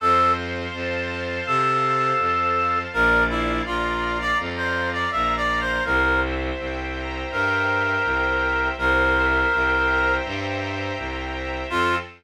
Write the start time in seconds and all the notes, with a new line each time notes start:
0.00 F2 A4 C5
0.37 F5
0.73 F2 A5
1.10 F5
1.46 C3 A4 C5
1.83 F5
2.19 F2 A5
2.56 F5
2.93 A#1 A#4 D5
3.29 E4 F5
3.66 A#1 F4 A#5
4.03 F5
4.21 D5
4.39 F2 D5
4.57 C5
4.75 F5
4.93 D5
5.11 A#1 E5 A#5
5.37 D5
5.49 F5
5.61 C5
5.85 C2 A#4 C5
6.22 E5
6.58 C2 G5
6.95 A#5
7.31 G2 A#4 G5
7.68 E5
8.04 C2 C5
8.42 E5
8.77 C2 A#4 C5
9.15 E5
9.52 C2 G5
9.88 A#5
10.24 G2 G5
10.61 E5
10.97 C2 C5
11.34 E5
11.70 F2 C4 F4 A4